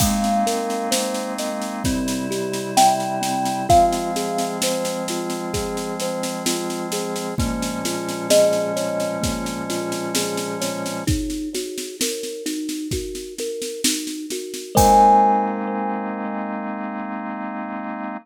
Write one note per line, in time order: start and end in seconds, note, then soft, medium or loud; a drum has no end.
0.00 1.83 G#3 medium
0.00 0.43 G#3 loud
0.00 1.83 A#3 loud
0.00 1.83 C4 loud
0.00 1.83 D#4 medium
0.00 2.52 F5 medium
0.00 kick loud
0.00 snare medium
0.00 crash loud
0.24 snare medium
0.47 0.88 A#4 medium
0.47 snare medium
0.70 snare medium
0.91 1.33 C5 medium
0.91 snare loud
1.14 snare medium
1.38 1.81 D#5 medium
1.38 snare medium
1.62 snare medium
1.84 3.67 C3 medium
1.84 3.67 G3 loud
1.84 2.27 C4 loud
1.84 3.67 E4 loud
1.84 kick medium
1.84 snare medium
2.08 snare medium
2.31 2.72 G4 medium
2.31 snare medium
2.53 snare medium
2.77 3.19 E5 medium
2.77 3.64 G5 medium
2.77 snare loud
3.00 snare medium
3.21 3.63 C4 medium
3.21 snare medium
3.45 snare medium
3.69 7.35 F3 loud
3.69 7.35 G#3 loud
3.69 7.35 C4 loud
3.69 4.11 F4 loud
3.69 7.34 F5 medium
3.69 kick loud
3.69 snare medium
3.93 snare medium
4.16 4.58 G#4 medium
4.16 snare medium
4.38 snare medium
4.62 5.05 C5 medium
4.62 snare loud
4.85 snare medium
5.08 5.51 F4 medium
5.08 snare medium
5.30 snare medium
5.54 5.95 G#4 medium
5.54 kick medium
5.54 snare medium
5.77 snare medium
6.00 6.43 C5 medium
6.00 snare medium
6.23 snare medium
6.46 6.88 F4 medium
6.46 snare loud
6.70 snare medium
6.92 7.34 G#4 medium
6.92 snare medium
7.16 snare medium
7.38 11.04 A#2 medium
7.38 11.04 F3 loud
7.38 11.04 G#3 loud
7.38 7.80 A#3 loud
7.38 11.04 C#4 loud
7.38 kick loud
7.38 snare medium
7.63 snare medium
7.85 8.27 F4 medium
7.85 snare medium
8.08 snare medium
8.30 8.72 G#4 medium
8.30 10.99 D#5 medium
8.30 snare loud
8.53 snare medium
8.76 9.18 C#5 medium
8.76 snare medium
9.00 snare medium
9.22 9.63 A#3 medium
9.22 kick medium
9.22 snare medium
9.46 snare medium
9.70 10.12 F4 medium
9.70 snare medium
9.92 snare medium
10.15 10.57 G#4 medium
10.15 snare loud
10.38 snare medium
10.61 11.03 C#5 medium
10.61 snare medium
10.86 snare medium
11.07 11.49 D#4 loud
11.07 kick loud
11.07 snare medium
11.30 snare medium
11.55 11.96 F#4 loud
11.55 snare medium
11.78 snare medium
12.01 12.43 A#4 medium
12.01 snare loud
12.23 snare medium
12.46 12.87 D#4 loud
12.46 snare medium
12.69 snare medium
12.91 13.34 F#4 medium
12.91 kick medium
12.91 snare medium
13.15 snare medium
13.38 13.81 A#4 medium
13.38 snare medium
13.62 snare medium
13.84 14.26 D#4 medium
13.84 snare loud
14.07 snare medium
14.30 14.73 F#4 medium
14.30 snare medium
14.54 snare medium
14.75 18.15 G#3 loud
14.75 18.17 G#3 loud
14.75 18.17 A#3 medium
14.75 18.17 C4 medium
14.75 18.17 D#4 loud
14.75 18.15 A#4 loud
14.75 18.15 C5 loud
14.75 18.15 D#5 medium
14.75 18.17 G#5 loud
14.75 kick loud
14.75 crash loud